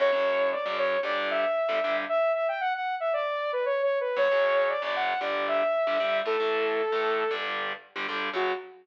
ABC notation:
X:1
M:4/4
L:1/16
Q:1/4=115
K:F#phr
V:1 name="Lead 2 (sawtooth)"
c4 d d c2 d2 e6 | e2 e g f f2 e d3 B (3c2 c2 B2 | c4 d d f2 d2 e6 | A10 z6 |
F4 z12 |]
V:2 name="Overdriven Guitar"
[F,,C,F,] [F,,C,F,]4 [F,,C,F,]3 [G,,D,G,]5 [G,,D,G,] [G,,D,G,]2 | z16 | [F,,C,F,] [F,,C,F,]4 [F,,C,F,]3 [G,,D,G,]5 [G,,D,G,] [G,,D,G,]2 | [A,,E,A,] [A,,E,A,]4 [A,,E,A,]3 [G,,D,G,]5 [G,,D,G,] [G,,D,G,]2 |
[F,,C,F,]4 z12 |]